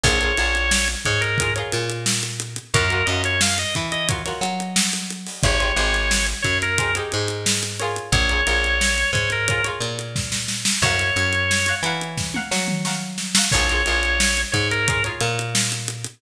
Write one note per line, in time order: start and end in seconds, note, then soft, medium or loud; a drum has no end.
0.03 0.32 A#1 medium
0.03 0.18 F4 loud
0.03 0.18 G#4 loud
0.03 0.18 A#4 loud
0.03 0.88 C#5 medium
0.03 0.18 C#5 loud
0.03 kick medium
0.03 crash loud
0.21 0.34 F4 medium
0.21 0.34 G#4 medium
0.21 0.34 A#4 loud
0.21 0.34 C#5 medium
0.21 closed hi-hat medium
0.37 0.95 A#1 medium
0.37 0.92 F4 medium
0.37 0.92 G#4 medium
0.37 0.92 A#4 loud
0.37 0.92 C#5 medium
0.37 closed hi-hat medium
0.55 closed hi-hat medium
0.71 snare loud
0.88 closed hi-hat medium
1.05 1.63 G#2 medium
1.05 1.21 C#5 medium
1.05 kick medium
1.05 closed hi-hat medium
1.21 1.54 A#4 medium
1.21 closed hi-hat medium
1.38 1.52 G#4 medium
1.38 1.52 A#4 medium
1.38 1.52 C#5 medium
1.38 kick medium
1.38 closed hi-hat loud
1.42 1.52 F4 loud
1.56 2.10 F4 medium
1.56 2.10 G#4 medium
1.56 2.10 A#4 medium
1.56 2.10 C#5 loud
1.56 closed hi-hat medium
1.72 2.59 A#2 medium
1.72 snare soft
1.72 closed hi-hat medium
1.89 closed hi-hat medium
2.06 snare loud
2.23 closed hi-hat medium
2.40 closed hi-hat medium
2.56 closed hi-hat medium
2.74 3.03 F#2 medium
2.74 2.87 F4 loud
2.74 2.87 F#4 loud
2.74 2.87 A#4 loud
2.74 3.07 A#4 medium
2.74 2.87 C#5 medium
2.74 kick loud
2.74 closed hi-hat loud
2.90 3.04 F4 medium
2.90 3.04 F#4 loud
2.90 3.04 A#4 medium
2.90 3.04 C#5 medium
2.90 closed hi-hat medium
3.06 3.65 F#2 medium
3.06 3.62 F#4 medium
3.06 3.62 A#4 medium
3.06 3.62 C#5 medium
3.06 3.22 D#5 medium
3.06 closed hi-hat medium
3.11 3.62 F4 medium
3.24 3.41 C#5 medium
3.24 closed hi-hat medium
3.41 3.58 F5 medium
3.41 snare loud
3.58 3.75 D#5 medium
3.58 closed hi-hat medium
3.75 4.33 E3 medium
3.75 kick medium
3.75 closed hi-hat medium
3.92 4.08 D#5 medium
3.92 closed hi-hat medium
4.08 4.22 F4 medium
4.08 4.22 F#4 medium
4.08 4.22 A#4 loud
4.08 4.22 C#5 loud
4.08 kick medium
4.08 closed hi-hat loud
4.25 4.79 F4 medium
4.25 4.79 F#4 medium
4.25 4.79 A#4 medium
4.25 4.79 C#5 medium
4.25 snare soft
4.25 closed hi-hat medium
4.41 5.27 F#3 medium
4.41 closed hi-hat medium
4.60 closed hi-hat medium
4.76 snare loud
4.93 closed hi-hat medium
5.10 closed hi-hat medium
5.26 open hi-hat medium
5.43 5.72 G#1 medium
5.43 5.57 D#4 loud
5.43 5.57 G4 loud
5.43 5.57 G#4 loud
5.43 5.57 C5 loud
5.43 6.26 C#5 medium
5.43 kick loud
5.43 closed hi-hat medium
5.60 5.74 D#4 medium
5.60 5.74 G4 medium
5.60 5.74 G#4 loud
5.60 5.74 C5 medium
5.60 closed hi-hat medium
5.76 6.34 G#1 medium
5.76 6.31 D#4 medium
5.76 6.31 G4 medium
5.76 6.31 G#4 medium
5.76 6.31 C5 medium
5.76 closed hi-hat medium
5.94 snare soft
5.94 closed hi-hat medium
6.11 snare loud
6.27 closed hi-hat medium
6.42 7.02 F#2 medium
6.42 6.58 C#5 medium
6.42 kick medium
6.42 closed hi-hat medium
6.62 6.95 A#4 medium
6.62 closed hi-hat medium
6.78 6.92 D#4 medium
6.78 6.92 G4 medium
6.78 6.92 G#4 medium
6.78 6.92 C5 medium
6.78 kick medium
6.78 closed hi-hat loud
6.95 7.49 D#4 medium
6.95 7.49 G4 medium
6.95 7.49 G#4 medium
6.95 7.49 C5 medium
6.95 closed hi-hat medium
7.12 7.99 G#2 medium
7.12 closed hi-hat medium
7.28 closed hi-hat medium
7.46 snare loud
7.62 snare soft
7.62 closed hi-hat medium
7.79 8.27 F4 loud
7.79 8.27 G#4 loud
7.79 8.27 A#4 loud
7.79 8.27 C#5 loud
7.79 closed hi-hat medium
7.96 closed hi-hat medium
8.12 8.41 A#1 medium
8.12 9.11 C#5 medium
8.12 kick loud
8.12 closed hi-hat medium
8.29 8.43 F4 medium
8.29 8.43 G#4 medium
8.29 8.43 A#4 medium
8.29 8.43 C#5 loud
8.29 closed hi-hat medium
8.47 9.04 A#1 medium
8.47 9.01 F4 loud
8.47 9.01 G#4 medium
8.47 9.01 A#4 loud
8.47 9.01 C#5 medium
8.47 closed hi-hat medium
8.64 closed hi-hat medium
8.81 snare loud
8.98 closed hi-hat medium
9.13 9.70 G#2 medium
9.13 9.30 C#5 medium
9.13 kick medium
9.13 closed hi-hat medium
9.30 9.65 A#4 medium
9.30 closed hi-hat medium
9.48 9.62 F4 medium
9.48 9.62 G#4 medium
9.48 9.62 A#4 medium
9.48 9.62 C#5 medium
9.48 kick medium
9.48 closed hi-hat medium
9.64 10.19 F4 medium
9.64 10.19 G#4 medium
9.64 10.19 A#4 medium
9.64 10.19 C#5 loud
9.64 closed hi-hat medium
9.80 10.66 A#2 medium
9.80 closed hi-hat medium
9.99 closed hi-hat medium
10.16 kick medium
10.16 snare medium
10.32 snare medium
10.48 snare medium
10.65 snare loud
10.82 11.11 F#2 medium
10.82 11.75 C#5 medium
10.82 11.37 F5 loud
10.82 11.37 F#5 loud
10.82 11.37 A#5 loud
10.82 11.37 C#6 loud
10.82 kick medium
10.82 crash loud
10.99 closed hi-hat medium
11.16 11.73 F#2 medium
11.16 closed hi-hat medium
11.33 closed hi-hat medium
11.51 snare medium
11.66 11.80 F5 medium
11.66 11.80 F#5 medium
11.66 11.80 A#5 medium
11.66 11.80 C#6 medium
11.66 closed hi-hat medium
11.83 12.40 E3 medium
11.83 12.24 F#5 medium
11.83 12.24 A#5 medium
11.83 12.24 C#6 medium
11.83 closed hi-hat medium
11.87 12.24 F5 medium
12.01 closed hi-hat medium
12.17 kick medium
12.17 snare medium
12.34 12.75 F5 medium
12.34 12.75 F#5 medium
12.34 12.75 A#5 medium
12.34 12.75 C#6 medium
12.34 high tom medium
12.51 13.37 F#3 medium
12.51 snare medium
12.68 mid tom medium
12.85 13.25 F5 loud
12.85 13.25 F#5 medium
12.85 13.25 A#5 medium
12.85 13.25 C#6 medium
12.85 snare medium
13.18 snare medium
13.35 13.49 F5 medium
13.35 13.49 F#5 loud
13.35 13.49 A#5 loud
13.35 13.49 C#6 loud
13.35 snare loud
13.51 13.82 A#1 medium
13.51 13.66 G#4 loud
13.51 13.66 A#4 loud
13.51 14.41 C#5 medium
13.51 13.66 C#5 loud
13.51 kick loud
13.51 crash loud
13.55 13.66 F4 loud
13.69 13.83 F4 loud
13.69 13.83 G#4 medium
13.69 13.83 A#4 loud
13.69 13.83 C#5 loud
13.69 closed hi-hat medium
13.86 14.44 A#1 medium
13.86 14.40 F4 loud
13.86 14.40 G#4 medium
13.86 14.40 A#4 loud
13.86 14.40 C#5 medium
13.86 closed hi-hat medium
14.03 closed hi-hat medium
14.20 snare loud
14.37 closed hi-hat medium
14.52 15.11 G#2 medium
14.52 14.68 C#5 medium
14.52 kick medium
14.52 closed hi-hat medium
14.71 15.03 A#4 medium
14.71 closed hi-hat medium
14.87 15.01 F4 loud
14.87 15.01 G#4 medium
14.87 15.01 A#4 medium
14.87 15.01 C#5 medium
14.87 kick loud
14.87 closed hi-hat loud
15.04 15.58 F4 medium
15.04 15.58 G#4 medium
15.04 15.58 A#4 loud
15.04 15.58 C#5 loud
15.04 closed hi-hat medium
15.21 16.07 A#2 medium
15.21 snare soft
15.21 closed hi-hat medium
15.39 closed hi-hat medium
15.55 snare loud
15.72 closed hi-hat medium
15.88 closed hi-hat medium
16.04 closed hi-hat medium